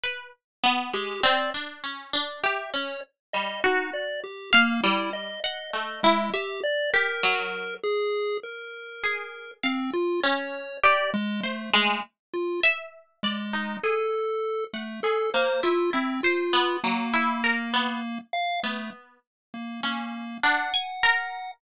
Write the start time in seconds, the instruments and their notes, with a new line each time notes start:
0.04 harpsichord B4
0.64 harpsichord B3
0.94 harpsichord G#3, lead 1 (square) G4
1.24 harpsichord C4, lead 1 (square) D5
1.54 harpsichord D4
1.84 harpsichord C#4
2.13 harpsichord D4
2.43 harpsichord G4, lead 1 (square) E5
2.74 harpsichord C#4, lead 1 (square) C#5
3.33 harpsichord G3, lead 1 (square) D#5
3.64 lead 1 (square) D#4, harpsichord F#4
3.94 lead 1 (square) D5
4.24 lead 1 (square) G4
4.53 lead 1 (square) A#3, harpsichord F5
4.83 harpsichord G3, lead 1 (square) E4
5.13 lead 1 (square) D#5
5.44 lead 1 (square) D#5, harpsichord F#5
5.74 harpsichord A3, lead 1 (square) D#5
6.03 lead 1 (square) G#3, harpsichord E4
6.33 lead 1 (square) G4, harpsichord E5
6.63 lead 1 (square) D5
6.94 harpsichord G4, lead 1 (square) A#4
7.23 harpsichord F#3
7.83 lead 1 (square) G#4
8.43 lead 1 (square) A#4
9.04 harpsichord G#4
9.63 lead 1 (square) C4, harpsichord F5
9.94 lead 1 (square) F4
10.23 harpsichord C#4, lead 1 (square) C#5
10.84 harpsichord G4, lead 1 (square) D5
11.14 lead 1 (square) G#3
11.44 lead 1 (square) A3, harpsichord C5
11.73 harpsichord G#3, lead 1 (square) A3
12.34 lead 1 (square) F4
12.63 harpsichord E5
13.23 lead 1 (square) G#3, harpsichord D5
13.53 harpsichord D#4
13.84 harpsichord G#4, lead 1 (square) A4
14.73 lead 1 (square) A3, harpsichord F#5
15.03 harpsichord G#4, lead 1 (square) A4
15.34 harpsichord A#3, lead 1 (square) C5
15.63 harpsichord E4, lead 1 (square) F4
15.93 lead 1 (square) C4, harpsichord E4
16.23 lead 1 (square) F4, harpsichord C5
16.53 harpsichord B3
16.84 harpsichord F#3, lead 1 (square) A#3
17.14 harpsichord E4
17.44 harpsichord A#4
17.73 harpsichord B3
18.33 lead 1 (square) F5
18.63 lead 1 (square) A3, harpsichord B3
19.54 lead 1 (square) A#3
19.83 lead 1 (square) A#3, harpsichord C#4
20.43 harpsichord D4, lead 1 (square) F#5
20.74 harpsichord G#5
21.03 harpsichord A#4